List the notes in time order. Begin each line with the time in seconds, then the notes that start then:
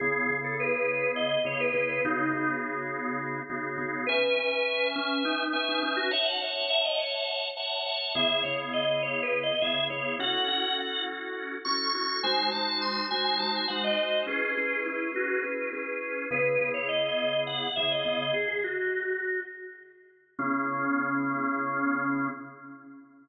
0.00 C#3 B3 E4 G#4
0.30 C#3 B3 E4 G#4
0.44 A4
0.60 B4
1.16 D#5
1.45 C#3 B3 E4 G#4 C#5
1.60 B4
1.74 C#3 B3 E4 G#4
1.89 B4
2.05 C#3 B3 D#4 F#4 G#4
2.33 C#3 B3 D#4 F#4 G#4
3.50 C#3 B3 D#4 F#4 G#4
3.78 C#3 B3 D#4 F#4 G#4
4.07 C#4 B4 E5 G#5
4.37 C#4 B4 E5 G#5
4.96 C#4
5.25 D#4
5.53 C#4 B4 E5 G#5
5.69 D#4
5.82 C#4 D#4 B4 E5 G#5
5.97 F#4
6.11 C#5 E5 F#5 A5
6.25 F#5
6.41 C#5 E5 F#5 A5
6.70 E5
6.85 D#5
6.98 C#5
7.57 C#5 E5 F#5 A5
7.86 C#5 E5 F#5 A5
8.15 C#3 B3 E4 G#4 E5
8.43 C#3 B3 E4 G#4 C#5
8.73 D#5
9.03 C#5
9.23 B4
9.43 D#5
9.62 C#3 B3 E4 G#4 E5
9.90 C#3 B3 E4 G#4 C#5
10.19 C#4 E4 F#4 A4 F#5
10.48 C#4 E4 F#4 A4 F#5
10.78 F#5
11.65 C#4 E4 F#4 A4 C#6
11.94 C#4 E4 F#4 A4 C#6
12.23 G#3 D#4 F#4 C5 G#5
12.52 G#3 D#4 F#4 C5 A5
12.82 C6
13.11 G#3 D#4 F#4 C5 G#5
13.24 G#5
13.39 G#3 D#4 F#4 C5 A5
13.56 G#5
13.68 G#3 D#4 F#4 C5 F#5
13.84 D#5
14.27 C#4 E4 G#4 B4
14.57 C#4 E4 G#4 B4
14.86 E4
15.14 C#4 E4 F#4 G#4 B4
15.43 C#4 E4 G#4 B4
15.73 C#4 E4 G#4 B4
16.31 C#3 B3 E4 G#4 B4
16.61 C#3 B3 E4 G#4
16.74 C#5
16.89 D#5
17.47 F#5
17.76 C#3 B3 E4 G#4 E5
17.92 D#5
18.05 C#3 B3 E4 G#4
18.20 D#5
18.34 G#4
18.48 G#4
18.64 F#4
20.39 C#3 B3 C#4 E4 G#4